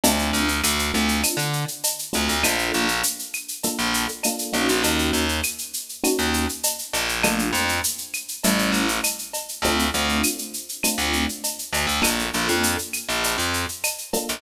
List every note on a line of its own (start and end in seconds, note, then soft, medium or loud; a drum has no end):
0.04 0.31 D2 loud
0.04 0.46 A3 medium
0.04 0.46 C4 medium
0.04 0.46 D4 medium
0.04 0.46 F4 medium
0.04 cowbell medium
0.04 shaker loud
0.19 shaker medium
0.33 0.60 D2 medium
0.33 shaker medium
0.48 shaker medium
0.63 0.91 D2 medium
0.63 claves medium
0.63 shaker medium
0.79 shaker medium
0.94 1.21 D2 medium
0.94 1.36 A3 medium
0.94 1.36 C4 medium
0.94 1.36 D4 medium
0.94 1.36 F4 medium
0.94 shaker medium
1.08 shaker medium
1.23 cowbell medium
1.23 claves medium
1.23 shaker medium
1.37 1.64 D3 loud
1.37 shaker medium
1.53 shaker medium
1.68 shaker medium
1.84 cowbell medium
1.84 shaker medium
1.99 shaker medium
2.13 2.29 D2 loud
2.13 2.34 A3 medium
2.13 2.34 C4 medium
2.13 2.34 D4 medium
2.13 2.34 F4 medium
2.13 cowbell medium
2.13 shaker medium
2.29 2.43 D2 medium
2.29 shaker medium
2.43 2.71 A#1 loud
2.43 2.85 A#3 medium
2.43 2.85 D4 medium
2.43 2.85 F4 medium
2.43 2.85 A4 medium
2.43 cowbell medium
2.43 claves loud
2.43 shaker medium
2.59 shaker medium
2.73 3.01 A#1 loud
2.73 shaker medium
2.88 shaker medium
3.03 shaker medium
3.19 shaker medium
3.33 claves medium
3.33 shaker medium
3.48 shaker medium
3.63 4.06 A#3 medium
3.63 4.06 D4 medium
3.63 4.06 F4 medium
3.63 4.06 A4 medium
3.63 cowbell medium
3.63 shaker medium
3.79 4.06 A#1 loud
3.79 shaker medium
3.94 shaker medium
4.08 shaker medium
4.23 4.52 A#3 medium
4.23 4.54 D4 medium
4.23 4.54 F4 medium
4.23 4.54 A4 medium
4.23 cowbell medium
4.23 claves medium
4.23 shaker medium
4.39 shaker medium
4.53 4.67 A#1 loud
4.53 5.25 A#3 medium
4.53 5.25 C#4 medium
4.53 5.25 D#4 medium
4.53 5.25 F#4 medium
4.53 cowbell medium
4.53 shaker medium
4.69 4.83 A#1 loud
4.69 shaker medium
4.83 5.10 D#2 loud
4.83 cowbell medium
4.83 shaker medium
4.99 shaker medium
5.13 5.40 D#2 loud
5.13 shaker medium
5.29 shaker medium
5.43 claves medium
5.43 shaker medium
5.58 shaker medium
5.74 shaker medium
5.89 shaker medium
6.04 6.46 A#3 medium
6.04 6.46 C#4 medium
6.04 6.46 D#4 medium
6.04 6.46 F#4 medium
6.04 cowbell medium
6.04 claves medium
6.04 shaker medium
6.18 6.46 D#2 medium
6.18 shaker medium
6.34 shaker medium
6.49 shaker medium
6.63 cowbell medium
6.63 shaker medium
6.79 shaker medium
6.93 7.50 A#1 loud
6.93 cowbell medium
6.93 shaker medium
7.09 shaker medium
7.23 7.66 A3 medium
7.23 7.66 A#3 medium
7.23 7.66 D4 medium
7.23 7.66 F4 medium
7.23 cowbell medium
7.23 claves loud
7.23 shaker medium
7.39 shaker medium
7.53 7.80 F2 loud
7.53 shaker medium
7.69 shaker medium
7.84 shaker medium
7.98 shaker medium
8.13 claves medium
8.13 shaker medium
8.28 shaker medium
8.44 8.71 A1 loud
8.44 8.87 G3 medium
8.44 8.87 A3 medium
8.44 8.87 C#4 medium
8.44 8.87 E4 medium
8.44 cowbell medium
8.44 shaker medium
8.59 shaker medium
8.72 8.99 A1 loud
8.72 shaker medium
8.88 shaker medium
9.03 cowbell medium
9.03 claves medium
9.03 shaker medium
9.19 shaker medium
9.33 cowbell medium
9.33 shaker medium
9.48 shaker medium
9.62 9.89 D2 loud
9.62 9.86 A3 medium
9.62 9.86 C4 medium
9.62 9.86 D4 medium
9.62 9.86 F4 medium
9.62 cowbell medium
9.62 shaker medium
9.79 shaker medium
9.94 10.21 D2 medium
9.94 10.36 A3 medium
9.94 10.36 C4 medium
9.94 10.36 D4 medium
9.94 10.36 F4 medium
9.94 shaker medium
10.09 shaker medium
10.23 claves medium
10.23 shaker medium
10.38 shaker medium
10.54 shaker medium
10.69 shaker medium
10.83 11.26 A3 medium
10.83 11.26 C4 medium
10.83 11.26 D4 medium
10.83 11.26 F4 medium
10.83 cowbell medium
10.83 claves medium
10.83 shaker medium
10.98 11.25 D2 medium
10.98 shaker medium
11.13 shaker medium
11.29 shaker medium
11.44 cowbell medium
11.44 shaker medium
11.59 shaker medium
11.73 11.86 D2 medium
11.73 cowbell medium
11.73 shaker medium
11.87 12.00 D2 loud
11.87 shaker medium
12.02 12.29 A#1 loud
12.02 12.23 A#3 medium
12.02 12.23 D4 medium
12.02 12.23 F4 medium
12.02 12.23 A4 medium
12.02 cowbell medium
12.02 claves medium
12.02 shaker medium
12.19 shaker medium
12.33 12.48 A#1 medium
12.33 12.76 A#3 medium
12.33 12.76 D4 medium
12.33 12.76 F4 medium
12.33 12.76 A4 medium
12.33 shaker medium
12.48 12.76 F2 medium
12.48 shaker medium
12.63 shaker medium
12.79 shaker medium
12.93 claves medium
12.93 shaker medium
13.09 13.36 A#1 loud
13.09 shaker medium
13.23 cowbell medium
13.23 shaker medium
13.38 13.65 F2 medium
13.38 shaker medium
13.54 shaker medium
13.69 shaker medium
13.84 cowbell medium
13.84 claves medium
13.84 shaker medium
13.98 shaker medium
14.13 14.35 A#3 medium
14.13 14.35 D4 medium
14.13 14.35 F4 medium
14.13 14.35 A4 medium
14.13 cowbell medium
14.13 shaker medium
14.29 14.41 A#1 medium
14.29 shaker medium